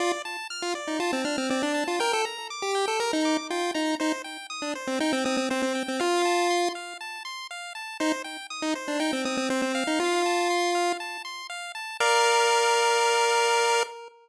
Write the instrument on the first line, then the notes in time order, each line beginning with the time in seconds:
lead 1 (square)
0.00 F4 D5
0.25 A5
0.50 F6
0.62 F4
0.75 D5
0.87 D#4
1.00 F4 A5
1.13 C4
1.25 D4 F6
1.38 C4
1.50 C4 D5
1.63 D4
1.74 A5
1.88 F4
2.00 A#4 G5
2.13 A4
2.25 A#5
2.50 D6
2.62 G4
2.75 G5
2.88 A4
3.00 A#4 A#5
3.13 D#4
3.25 D6
3.50 F4 G5
3.74 D#4 A#5
4.00 D#4 C5
4.24 G5
4.50 D#6
4.62 D4
4.75 C5
4.87 C4
5.00 D#4 G5
5.13 C4
5.25 C4 D#6
5.37 C4
5.50 C4 C5
5.62 C4
5.75 G5
5.88 C4
6.00 F4 F5
6.25 A5
6.50 C6
6.75 F5
7.01 A5
7.25 C6
7.51 F5
7.75 A5
8.00 D#4 C5
8.24 G5
8.50 D#6
8.62 D#4
8.75 C5
8.88 D4
9.00 D#4 G5
9.13 C4
9.25 C4 D#6
9.37 C4
9.50 C4 C5
9.62 C4
9.75 F5
9.87 D#4
10.00 F4
10.26 A5
10.50 C6
10.75 F5
11.00 A5
11.25 C6
11.50 F5
11.75 A5
12.00 A#4 D5 F5